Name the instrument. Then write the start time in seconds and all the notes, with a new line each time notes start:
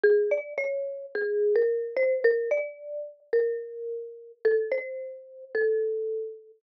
marimba
0.04 G#4
0.31 D5
0.58 C#5
1.15 G#4
1.56 A#4
1.97 C5
2.24 A#4
2.51 D5
3.33 A#4
4.45 A4
4.72 C5
5.55 A4